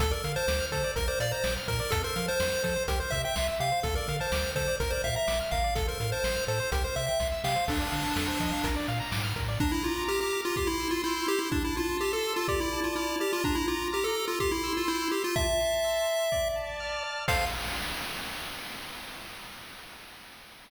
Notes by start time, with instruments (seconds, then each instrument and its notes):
0.00 synth bass 1 D2, lead 1 (square) A4, kick, closed hi-hat
0.11 lead 1 (square) A#4 D5
0.24 synth bass 1 D3, lead 1 (square) F5, closed hi-hat
0.36 lead 1 (square) C5 A5
0.48 synth bass 1 D2, lead 1 (square) D6, snare
0.60 lead 1 (square) F6
0.72 synth bass 1 D3, lead 1 (square) A4 C5, kick, closed hi-hat
0.84 lead 1 (square) D5
0.96 synth bass 1 A#1, lead 1 (square) A#4, kick, closed hi-hat
1.08 lead 1 (square) C5 D5
1.20 synth bass 1 A#2, lead 1 (square) D5 F5, closed hi-hat
1.32 lead 1 (square) C5 A#5
1.44 synth bass 1 A#1, lead 1 (square) D6, snare
1.56 lead 1 (square) F6
1.68 synth bass 1 A#2, lead 1 (square) A#4, kick
1.80 lead 1 (square) D5
1.91 synth bass 1 F2, lead 1 (square) A4, kick, closed hi-hat
2.04 lead 1 (square) A#4 C5
2.16 synth bass 1 F3, lead 1 (square) F5, closed hi-hat
2.28 lead 1 (square) C5 A5
2.40 synth bass 1 F2, lead 1 (square) C6, snare
2.52 lead 1 (square) F6
2.64 synth bass 1 F3, lead 1 (square) A4 C5, kick, closed hi-hat
2.76 lead 1 (square) C5
2.88 synth bass 1 C2, lead 1 (square) G4 A#4, kick, closed hi-hat
3.00 lead 1 (square) C5
3.10 synth bass 1 C3, lead 1 (square) E5, kick, closed hi-hat
3.24 lead 1 (square) E5 G5
3.36 synth bass 1 C2, lead 1 (square) C6, snare
3.48 lead 1 (square) E6
3.60 synth bass 1 C3, lead 1 (square) G4 F5, closed hi-hat
3.72 lead 1 (square) C5
3.83 synth bass 1 D2, lead 1 (square) A4, kick, closed hi-hat
3.95 lead 1 (square) A#4 D5
4.08 synth bass 1 D3, lead 1 (square) F5, closed hi-hat
4.21 lead 1 (square) C5 A5
4.32 synth bass 1 D2, lead 1 (square) D6, snare
4.44 lead 1 (square) F6
4.56 synth bass 1 D3, lead 1 (square) A4 C5, kick, closed hi-hat
4.67 lead 1 (square) D5
4.80 synth bass 1 A#1, lead 1 (square) A#4, kick, closed hi-hat
4.90 lead 1 (square) C5 D5
5.04 synth bass 1 A#2, lead 1 (square) E5 F5, kick, closed hi-hat
5.16 lead 1 (square) E5 A#5
5.27 synth bass 1 A#1, lead 1 (square) D6, snare
5.40 lead 1 (square) F6
5.51 synth bass 1 A1, lead 1 (square) A#4 F5, kick, closed hi-hat
5.64 lead 1 (square) D5
5.75 lead 1 (square) A4, kick, closed hi-hat
5.87 lead 1 (square) A#4 C5
6.00 synth bass 1 A2, lead 1 (square) F5, closed hi-hat
6.12 lead 1 (square) C5 A5
6.24 synth bass 1 A1, lead 1 (square) C6, snare
6.35 lead 1 (square) F6
6.48 synth bass 1 A2, lead 1 (square) A4 C5, closed hi-hat
6.60 lead 1 (square) C5
6.72 synth bass 1 C2, lead 1 (square) G4 A#4, kick, closed hi-hat
6.84 lead 1 (square) C5
6.96 synth bass 1 C3, lead 1 (square) E5, closed hi-hat
7.06 lead 1 (square) E5 G5
7.20 synth bass 1 C2, lead 1 (square) C6, kick, snare
7.32 lead 1 (square) E6
7.44 synth bass 1 C3, lead 1 (square) G4 F5, snare
7.56 lead 1 (square) C5
7.68 synth bass 1 D2, lead 1 (square) D4 A4, kick, crash
7.80 lead 1 (square) D5
7.92 synth bass 1 D3, lead 1 (square) F5, closed hi-hat
8.04 lead 1 (square) A5
8.16 synth bass 1 F2, lead 1 (square) A4, snare
8.28 lead 1 (square) C5
8.40 synth bass 1 F3, lead 1 (square) D#5, kick, closed hi-hat
8.52 lead 1 (square) F5
8.64 synth bass 1 A#1, lead 1 (square) A#4, kick, closed hi-hat
8.76 lead 1 (square) D5
8.88 synth bass 1 A#2, lead 1 (square) F5, closed hi-hat
9.00 lead 1 (square) A#5
9.12 synth bass 1 G#2, lead 1 (square) D6, snare
9.24 lead 1 (square) F6
9.36 synth bass 1 A2, lead 1 (square) A#4, kick, closed hi-hat
9.48 lead 1 (square) D5
9.60 lead 1 (square) D4 A#5, kick
9.72 lead 1 (square) E4
9.84 lead 1 (square) F4 D6
10.08 lead 1 (square) G4 F6
10.21 lead 1 (square) G4
10.33 lead 1 (square) A#5
10.45 lead 1 (square) F4
10.56 lead 1 (square) G4 C6, kick
10.67 lead 1 (square) E4
10.80 lead 1 (square) E6
10.91 lead 1 (square) F4
11.04 lead 1 (square) E4 G6
11.28 lead 1 (square) G4 C6
11.39 lead 1 (square) E4
11.52 lead 1 (square) D4 A5, kick
11.64 lead 1 (square) E4
11.76 lead 1 (square) F4 C6
12.01 lead 1 (square) G4 E6
12.13 lead 1 (square) A4
12.24 lead 1 (square) A5
12.36 lead 1 (square) F4
12.48 lead 1 (square) G4 D5, kick
12.60 lead 1 (square) E4
12.73 lead 1 (square) A5
12.84 lead 1 (square) F4
12.96 lead 1 (square) E4 F6
13.20 lead 1 (square) G4 D5
13.33 lead 1 (square) F4
13.44 lead 1 (square) D4 A#5, kick
13.55 lead 1 (square) E4
13.68 lead 1 (square) F4 D6
13.93 lead 1 (square) G4 F6
14.04 lead 1 (square) A4
14.16 lead 1 (square) A#5
14.28 lead 1 (square) F4
14.40 lead 1 (square) G4 C6, kick
14.52 lead 1 (square) E4
14.63 lead 1 (square) E6
14.77 lead 1 (square) F4
14.88 lead 1 (square) E4 G6
15.11 lead 1 (square) G4 C6
15.24 lead 1 (square) F4
15.36 lead 1 (square) E5 A5, kick
15.60 lead 1 (square) C6
15.84 lead 1 (square) E6
16.07 lead 1 (square) A5
16.32 lead 1 (square) D5, kick
16.56 lead 1 (square) A5
16.80 lead 1 (square) F6
17.04 lead 1 (square) D5
17.28 lead 1 (square) A4 C5 F5, kick, crash